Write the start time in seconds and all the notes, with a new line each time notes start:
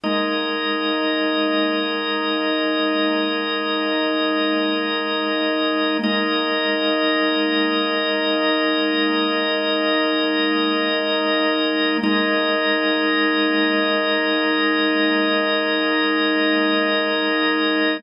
0.04 G#3 A#3 D#4 A#4 D#5
6.03 G#3 A#3 D#4 A#4 D#5
12.03 G#3 A#3 D#4 A#4 D#5